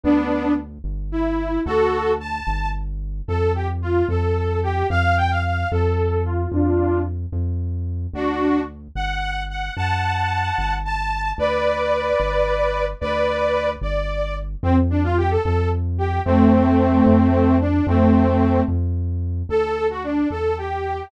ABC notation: X:1
M:6/8
L:1/16
Q:3/8=74
K:Dmix
V:1 name="Lead 2 (sawtooth)"
[B,D]4 z4 E4 | [FA]4 a4 z4 | [K:Fmix] A2 G z F2 A4 G2 | f2 g f f2 A4 F2 |
[DF]4 z8 | [K:Dmix] [DF]4 z2 f4 f2 | [fa]8 a4 | [Bd]12 |
[Bd]6 d4 z2 | [K:Fmix] C z D F G A A2 z2 G2 | [A,C]10 D2 | [A,C]6 z6 |
[K:Dmix] A3 F D2 A2 G4 |]
V:2 name="Synth Bass 1" clef=bass
D,,6 G,,,6 | D,,6 G,,,6 | [K:Fmix] F,,6 F,,6 | F,,6 F,,6 |
F,,6 F,,6 | [K:Dmix] D,,6 G,,,6 | F,,6 G,,,6 | D,,6 G,,,6 |
D,,6 G,,,6 | [K:Fmix] F,,6 F,,6 | F,,6 F,,6 | F,,6 F,,6 |
[K:Dmix] D,,6 E,,6 |]